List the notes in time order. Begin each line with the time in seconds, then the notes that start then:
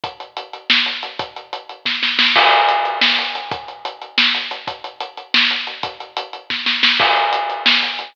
0.04 kick, closed hi-hat
0.20 closed hi-hat
0.37 closed hi-hat
0.53 closed hi-hat
0.70 snare
0.86 closed hi-hat
1.03 closed hi-hat
1.19 kick, closed hi-hat
1.36 closed hi-hat
1.53 closed hi-hat
1.69 closed hi-hat
1.85 kick, snare
2.03 snare
2.19 snare
2.36 kick, crash
2.52 closed hi-hat
2.69 closed hi-hat
2.85 closed hi-hat
3.01 snare
3.19 closed hi-hat
3.35 closed hi-hat
3.52 kick, closed hi-hat
3.68 closed hi-hat
3.85 closed hi-hat
4.02 closed hi-hat
4.18 snare
4.35 closed hi-hat
4.51 closed hi-hat
4.67 kick, closed hi-hat
4.84 closed hi-hat
5.00 closed hi-hat
5.17 closed hi-hat
5.34 snare
5.51 closed hi-hat
5.67 closed hi-hat
5.83 kick, closed hi-hat
6.00 closed hi-hat
6.17 closed hi-hat
6.33 closed hi-hat
6.50 kick, snare
6.66 snare
6.83 snare
7.00 kick, crash
7.16 closed hi-hat
7.33 closed hi-hat
7.50 closed hi-hat
7.66 snare
7.83 closed hi-hat
7.99 closed hi-hat